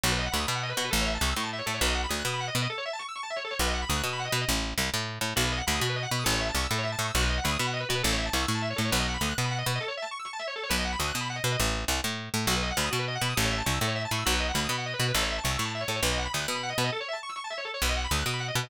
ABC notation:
X:1
M:6/8
L:1/16
Q:3/8=135
K:Bmix
V:1 name="Drawbar Organ"
F B d f b d' b f d B F B | A c e a c' e' c' a e c A c | B d f b d' f' d' b f d B d | A c e a c' e' c' a e c A c |
B d f b d' f' d' b f d B d | z12 | F B d f b d' F B d f b d' | A c e a c' e' A c e a c' e' |
F B d f b d' b f d B F B | A c e a c' e' c' a e c A c | B d f b d' f' d' b f d B d | A c e a c' e' c' a e c A c |
B d f b d' f' d' b f d B d | z12 | F B d f b d' F B d f b d' | A c e a c' e' A c e a c' e' |
F B d f b d' b f d B F B | A c e a c' e' c' a e c A c | B d f b d' f' d' b f d B d | A c e a c' e' c' a e c A c |
B d f b d' f' d' b f d B d |]
V:2 name="Electric Bass (finger)" clef=bass
B,,,4 =D,,2 B,,4 B,,2 | A,,,4 =C,,2 A,,4 A,,2 | B,,,4 =D,,2 B,,4 B,,2 | z12 |
B,,,4 =D,,2 B,,4 B,,2 | A,,,4 =C,,2 A,,4 A,,2 | B,,,4 =D,,2 B,,4 B,,2 | A,,,4 =C,,2 A,,4 A,,2 |
B,,,4 =D,,2 B,,4 B,,2 | A,,,4 =C,,2 A,,4 A,,2 | B,,,4 =D,,2 B,,4 B,,2 | z12 |
B,,,4 =D,,2 B,,4 B,,2 | A,,,4 =C,,2 A,,4 A,,2 | B,,,4 =D,,2 B,,4 B,,2 | A,,,4 =C,,2 A,,4 A,,2 |
B,,,4 =D,,2 B,,4 B,,2 | A,,,4 =C,,2 A,,4 A,,2 | B,,,4 =D,,2 B,,4 B,,2 | z12 |
B,,,4 =D,,2 B,,4 B,,2 |]